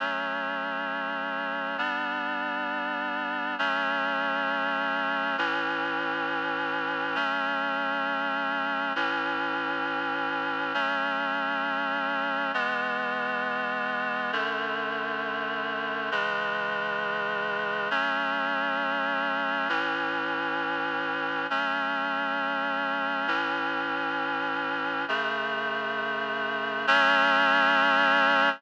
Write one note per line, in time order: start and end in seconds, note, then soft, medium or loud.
0.00 1.76 F#3 medium
0.00 1.76 A3 medium
0.00 1.76 C#4 medium
1.78 3.55 G3 medium
1.78 3.55 B3 medium
1.78 3.55 D4 medium
3.58 5.36 F#3 medium
3.58 5.36 A3 medium
3.58 5.36 C#4 medium
5.38 7.15 A2 medium
5.38 7.15 E3 medium
5.38 7.15 C#4 medium
7.15 8.92 F#3 medium
7.15 8.92 A3 medium
7.15 8.92 C#4 medium
8.95 10.73 A2 medium
8.95 10.73 E3 medium
8.95 10.73 C#4 medium
10.74 12.51 F#3 medium
10.74 12.51 A3 medium
10.74 12.51 C#4 medium
12.54 14.31 E3 medium
12.54 14.31 G#3 medium
12.54 14.31 B3 medium
14.32 16.10 F#2 medium
14.32 16.10 D3 medium
14.32 16.10 A3 medium
16.11 17.89 C#3 medium
16.11 17.89 E3 medium
16.11 17.89 G#3 medium
17.90 19.68 F#3 medium
17.90 19.68 A3 medium
17.90 19.68 C#4 medium
19.69 21.46 A2 medium
19.69 21.46 E3 medium
19.69 21.46 C#4 medium
21.50 23.27 F#3 medium
21.50 23.27 A3 medium
21.50 23.27 C#4 medium
23.27 25.05 A2 medium
23.27 25.05 E3 medium
23.27 25.05 C#4 medium
25.08 26.86 F#2 medium
25.08 26.86 C#3 medium
25.08 26.86 A3 medium
26.87 28.49 F#3 loud
26.87 28.49 A3 medium
26.87 28.49 C#4 loud